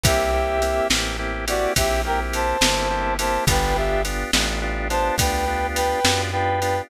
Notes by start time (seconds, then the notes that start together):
0.04 C2 A#3 C4 E4 G4 E5, kick, ride
0.33 A#3 C4 E4 G4
0.62 A#3 C4 E4 G4, ride
0.90 A1 A#3 C4 E4 G4, snare
1.19 A#3 C4 E4 G4
1.48 A#3 C4 E4 F#4 G4 D5, ride
1.76 A#1 A#3 C4 E4 G4 E5, kick, ride
2.05 A#3 C4 E4 G4 A#4 G5
2.33 C5 A5, ride
2.61 G1 A#3 C4 E4 G4, snare
2.90 A#3 C4 E4 G4
3.19 A#3 C4 E4 G4 C5 A5, ride
3.47 G1 B3 D4 F4 G4 B4 G5, kick, ride
3.76 B3 D4 F4 G4 E5
4.05 B3 D4 F4 G4, ride
4.33 A1 B3 D4 F4 G4, snare
4.62 B3 D4 F4 G4
4.90 B3 D4 F4 G4 C5 A5, ride
5.18 D2 B3 D4 F4 G4 B4 G5, kick, ride
5.48 B3 D4 F4 G4
5.75 B4 G5, ride
6.05 F#2 B3 D4 F4 G4, snare
6.32 B3 D4 F4 G4 B4 G5
6.62 B3 D4 F4 G4, ride